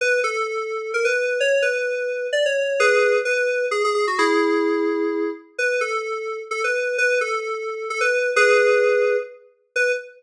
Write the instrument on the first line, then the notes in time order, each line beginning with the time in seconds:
electric piano 2
0.01 B4
0.24 A4
0.94 A#4
1.05 B4
1.40 C#5
1.62 B4
2.33 D5
2.46 C#5
2.80 G#4 B4
3.25 B4
3.71 G#4
3.84 G#4
3.94 G#4
4.07 F#4
4.18 E4 G#4
5.58 B4
5.81 A4
6.51 A4
6.64 B4
6.98 B4
7.21 A4
7.90 A4
8.01 B4
8.36 G#4 B4
9.76 B4